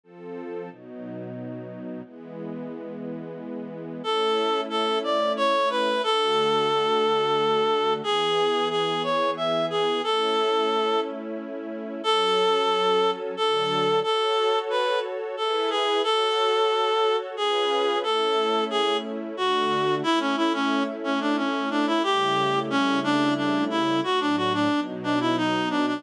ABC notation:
X:1
M:3/4
L:1/16
Q:1/4=90
K:A
V:1 name="Clarinet"
z12 | z12 | A4 A2 d2 c2 B2 | A12 |
G4 G2 c2 e2 G2 | A6 z6 | [K:F#m] A8 A4 | A4 B2 z2 A2 G2 |
A8 G4 | A4 G2 z2 F4 | [K:A] E C E C2 z C D C2 D E | =G4 C2 D2 D2 E2 |
F D F D2 z D E ^D2 =D D |]
V:2 name="String Ensemble 1"
[=F,=CA]4 [B,,^F,^D]8 | [E,G,B,]12 | [A,CE]12 | [D,A,F]12 |
[E,B,G]12 | [A,CE]12 | [K:F#m] [F,CA]8 [D,F,A]4 | [FAc]8 [EGB]4 |
[FAc]8 [C^EGB]4 | [A,CE]8 [D,A,F]4 | [K:A] [A,CE]12 | [C,=G,A,E]12 |
[A,,F,D]4 [B,,F,^D]8 |]